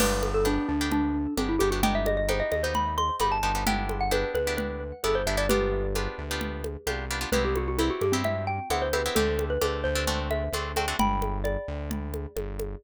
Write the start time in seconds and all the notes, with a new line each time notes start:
0.00 G1 B3 D4 G4 B4, crash, low conga
0.23 high conga
0.34 A4
0.45 B3 D4 G4, high conga
0.69 D2 D4
0.81 B3 D4 G4
0.92 D4, low conga
1.37 G1 B3 C4 D4 G4, high conga
1.49 E4
1.59 G1 B3 D4 G4, high conga
1.71 B3 D4 F#4 G4
1.83 B3 D#4 G4 G5, low conga
1.95 E5
2.06 D#5, high conga
2.17 D#5
2.29 B3 D#4 G4 C5, high conga
2.40 D#5
2.52 D#2 D#5, high conga
2.63 B3 D#4 G4 C5
2.75 B5, low conga
2.98 C6, high conga
3.20 G1 B3 D#4 G4 B5, high conga
3.32 A5
3.43 G1 B3 D#4 G4 A5
3.55 B3 D#4 G4
3.67 B3 D4 E4 G4 G5, low conga
3.89 high conga
4.01 F#5
4.11 B3 D4 E4 G4 B4, high conga
4.34 D2 B4, high conga
4.47 B3 D4 E4 G4
4.57 B4, low conga
5.04 G1 B3 D4 E4 G4 A4, high conga
5.15 C5
5.27 G1 B3 D4 E4 G4 E5
5.37 B3 D4 E4 G4 D5
5.49 B3 D4 F4 G4 B4, low conga
5.95 B3 D4 F4 G4, high conga
6.18 D2
6.31 B3 D4 F4 G4
6.41 low conga
6.64 high conga
6.87 C2 B3 D4 F4 G4, high conga
7.11 B3 D4 F4 G4
7.21 B3 D4 F4 G4
7.32 C2 B3 C4 E4 G4 B4, low conga
7.45 G4
7.56 F#4, high conga
7.68 F#4
7.78 B3 C4 E4 G4, high conga
7.90 F#4
8.01 G2 G4, high conga
8.12 B3 C4 E4 G4
8.24 E5, low conga
8.47 G5
8.70 D2 B3 C4 E4 G4 F#5, high conga
8.82 C5
8.93 B3 C4 E4 G4 B4, high conga
9.06 B3 C4 E4 G4
9.15 D2 A3 C4 D4 G4 A4, low conga
9.39 high conga
9.50 B4
9.61 D2 A3 C4 D4 G4, high conga
9.84 D2 C5
9.95 A3 C4 D4 G4
10.07 A3 C4 D4 F#4, low conga
10.31 E5, high conga
10.52 D2 A3 C4 D4 F#4, high conga
10.76 A3 C4 D4 F#4 G5, high conga
10.88 A3 C4 D4 F#4
10.99 G1 G5 B5, low conga
11.22 high conga
11.44 D5, high conga
11.68 D2
11.91 low conga
12.14 high conga
12.36 G1, high conga
12.60 high conga